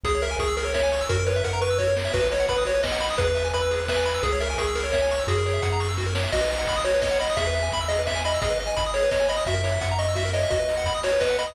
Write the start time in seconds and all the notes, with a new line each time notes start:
0.03 C#2 G#4, kick, closed hi-hat
0.15 C#5
0.22 A#4 E5, open hi-hat
0.31 G#5
0.39 C#2 G#4 C#6, kick, closed hi-hat
0.48 E6
0.57 G#4 A#4, open hi-hat
0.65 C#5
0.74 C#5 E5, kick, snare
0.83 G#5
0.92 C#6, open hi-hat
1.01 E6
1.09 F#2 F#4 A#4, kick, closed hi-hat
1.19 A#4
1.27 B4 C#5, open hi-hat
1.36 E5
1.44 F#2 A#4 F#5, kick, closed hi-hat
1.53 A#5
1.61 B4 C#6, open hi-hat
1.70 E6
1.78 F#4 C#5, kick, snare
1.87 A#4
1.96 C#5, snare
2.05 E5
2.13 B1 F#4 B4, kick, crash
2.22 B4
2.31 C#5 D#5, open hi-hat
2.40 F#5
2.48 B1 B4 B5, kick, closed hi-hat
2.58 D#6
2.65 F#4 C#5, open hi-hat
2.74 B4
2.83 D#5, kick, snare
2.92 F#5
3.00 B5, open hi-hat
3.10 D#6
3.18 E2 G#4 B4, kick, closed hi-hat
3.27 B4
3.35 E5, open hi-hat
3.44 G#5
3.53 E2 B4 B5, kick, closed hi-hat
3.62 E6
3.71 G#4, open hi-hat
3.80 B4
3.88 B4 E5, kick, snare
3.96 G#5
4.05 B5, open hi-hat
4.14 E6
4.23 C#2 G#4, kick, closed hi-hat
4.32 C#5
4.40 A#4 E5, open hi-hat
4.50 G#5
4.57 C#2 G#4 C#6, kick, closed hi-hat
4.67 E6
4.75 G#4 A#4, open hi-hat
4.84 C#5
4.92 C#5 E5, kick, snare
5.02 G#5
5.11 C#6, open hi-hat
5.19 E6
5.27 F#2 F#4 G#4, kick, closed hi-hat
5.38 A#4
5.46 C#5, open hi-hat
5.54 E5
5.62 F#2 F#5, kick, closed hi-hat
5.72 A#5
5.80 C#6, open hi-hat
5.89 E6
5.97 F#4, kick, snare
6.06 A#4
6.15 C#5, snare
6.23 E5
6.32 B1 F#4 D#5, kick, crash
6.41 B4
6.50 D#5, open hi-hat
6.59 F#5
6.67 B1 B5, kick, closed hi-hat
6.76 D#6
6.84 F#4 C#5, open hi-hat
6.94 B4
7.02 C#5 D#5, kick, snare
7.11 F#5
7.19 D#5 B5, open hi-hat
7.30 D#6
7.37 E2 G#4 E5, kick, closed hi-hat
7.47 B4
7.55 E5, open hi-hat
7.63 G#5
7.72 E2 B5, kick, closed hi-hat
7.81 E6
7.88 G#4 D#5, open hi-hat
7.99 B4
8.07 E5, kick, snare
8.15 G#5
8.24 D#5 B5, open hi-hat
8.34 E6
8.41 G#1 G#4 D#5, kick, closed hi-hat
8.50 B4
8.59 D#5, open hi-hat
8.67 G#5
8.76 G#1 B5, kick, closed hi-hat
8.86 D#6
8.94 G#4 C#5, open hi-hat
9.03 B4
9.11 C#5 D#5, kick, snare
9.20 G#5
9.28 D#5 B5, open hi-hat
9.37 D#6
9.46 F#2 F#4 E5, kick, closed hi-hat
9.54 A#4
9.64 C#5, open hi-hat
9.72 E5
9.81 F#2 F#5, kick, closed hi-hat
9.91 A#5
9.99 D#5 C#6, open hi-hat
10.08 E6
10.15 F#4 E5, kick, snare
10.25 A#4
10.33 C#5 D#5, open hi-hat
10.43 E5
10.50 D#2 F#4 D#5, kick, closed hi-hat
10.59 B4
10.68 D#5, open hi-hat
10.77 F#5
10.86 D#2 B5, kick, closed hi-hat
10.94 D#6
11.03 F#4 C#5, open hi-hat
11.12 B4
11.20 B4 D#5, kick, snare
11.30 F#5
11.38 D#5 B5, open hi-hat
11.47 D#6